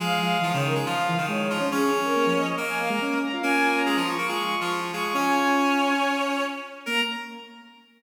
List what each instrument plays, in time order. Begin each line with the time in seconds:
0.00 lead 1 (square) F3, clarinet G#3 G#4, violin F5
0.21 lead 1 (square) F3, violin F5
0.41 lead 1 (square) E3, clarinet F3 F4
0.53 lead 1 (square) C#3, clarinet D#3 D#4, violin C#5
0.64 violin A#4
0.75 clarinet G#3 G#4
0.86 clarinet F3 F4, violin F5
1.08 lead 1 (square) E3
1.18 clarinet D#3 D#4, lead 1 (square) D#3
1.28 lead 1 (square) G#3, violin C#5
1.50 clarinet F3 F4
1.60 lead 1 (square) C#4
1.71 clarinet C#4 C#5, lead 1 (square) C#4, violin G#4
1.93 lead 1 (square) C#4
2.04 violin A#4
2.16 lead 1 (square) A#3
2.26 lead 1 (square) F3
2.36 violin D#5
2.57 clarinet A#3 A#4, violin D#5
2.68 violin G#5
2.79 lead 1 (square) A#3, violin F5
2.89 lead 1 (square) G#3, violin A#5
3.01 lead 1 (square) C#4
3.21 violin A#5
3.32 lead 1 (square) F4, violin F5
3.43 clarinet A#3 A#4, lead 1 (square) C#4 F4, violin G#5
3.75 violin A#5
3.86 clarinet G#3 G#4
3.96 clarinet F3 F4
4.07 lead 1 (square) F4, violin C#6
4.18 clarinet A#3 A#4
4.28 clarinet G#3 G#4, lead 1 (square) F4, violin C#6
4.39 violin C#6
4.50 violin C#6
4.61 clarinet F3 F4, violin C#6
4.93 clarinet G#3 G#4, lead 1 (square) F4, violin C#6
5.04 violin C#6
5.14 lead 1 (square) C#4 F4, clarinet C#4 C#5, violin G#5
5.36 violin G#5
5.57 violin G#5
6.86 lead 1 (square) A#3, clarinet A#4, violin A#5